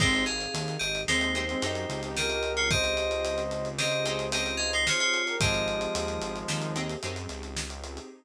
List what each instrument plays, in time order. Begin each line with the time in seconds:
0.00 synth bass 1 G#1, brass section G#3 C4, pad 2 (warm) C4 D#4 G4 G#4, acoustic guitar (steel) C4 D#4 G4 G#4, electric piano 2 D#4 C5, kick, crash
0.14 closed hi-hat
0.26 electric piano 2 G#4 F5, closed hi-hat
0.40 closed hi-hat
0.54 synth bass 1 D#2, closed hi-hat
0.68 closed hi-hat
0.79 synth bass 1 G#1, electric piano 2 G4 D#5, closed hi-hat
0.95 closed hi-hat
1.08 synth bass 1 D#2, brass section G#3 C4, acoustic guitar (steel) C4 D#4 G4 G#4, electric piano 2 D#4 C5, snare
1.21 closed hi-hat
1.35 acoustic guitar (steel) C4 D#4 G4 G#4, closed hi-hat
1.49 brass section G#3 C4, closed hi-hat
1.62 synth bass 1 F#2, acoustic guitar (steel) C4 D#4 G4 G#4, brass section D#4 G4, closed hi-hat
1.75 closed hi-hat
1.89 synth bass 1 C#2, closed hi-hat
2.03 brass section D#4 G4, closed hi-hat
2.16 brass section G4 A#4, electric piano 2 G4 D#5, snare
2.30 brass section G4 A#4, closed hi-hat
2.43 closed hi-hat
2.57 electric piano 2 F4 C#5, closed hi-hat
2.70 electric piano 2 G4 D#5, brass section C5 D#5, kick, closed hi-hat
2.84 closed hi-hat
2.97 closed hi-hat
3.11 closed hi-hat
3.25 closed hi-hat
3.38 closed hi-hat
3.51 closed hi-hat
3.65 closed hi-hat
3.78 acoustic guitar (steel) C4 D#4 G4 G#4, electric piano 2 G4 D#5, brass section C5 D#5, snare
3.91 closed hi-hat
4.05 acoustic guitar (steel) C4 D#4 G4 G#4, brass section G#4 C5, closed hi-hat
4.19 closed hi-hat
4.32 acoustic guitar (steel) C4 D#4 G4 G#4, electric piano 2 G4 D#5, brass section C5 D#5, closed hi-hat
4.46 closed hi-hat
4.57 electric piano 2 G#4 F5, closed hi-hat
4.73 electric piano 2 D#4 C5, closed hi-hat
4.86 electric piano 2 F4 C#5, brass section G#4 C5, snare
5.00 electric piano 2 F4 C#5, closed hi-hat
5.14 closed hi-hat
5.27 brass section G4 A#4, closed hi-hat
5.40 synth bass 1 G#1, brass section F3 G#3, pad 2 (warm) C4 D#4 G4 G#4, acoustic guitar (steel) C4 D#4 G4 G#4, electric piano 2 G4 D#5, kick, closed hi-hat
5.54 closed hi-hat
5.68 closed hi-hat
5.81 closed hi-hat
5.95 synth bass 1 D#2, closed hi-hat
6.08 closed hi-hat
6.21 synth bass 1 G#1, closed hi-hat
6.36 closed hi-hat
6.48 synth bass 1 D#2, acoustic guitar (steel) C4 D#4 G4 G#4, snare
6.62 closed hi-hat
6.76 acoustic guitar (steel) C4 D#4 G4 G#4, closed hi-hat
6.89 closed hi-hat
7.03 synth bass 1 F#2, acoustic guitar (steel) C4 D#4 G4 G#4, closed hi-hat
7.16 closed hi-hat
7.29 synth bass 1 C#2, closed hi-hat
7.43 closed hi-hat
7.57 snare
7.70 closed hi-hat
7.84 closed hi-hat
7.97 closed hi-hat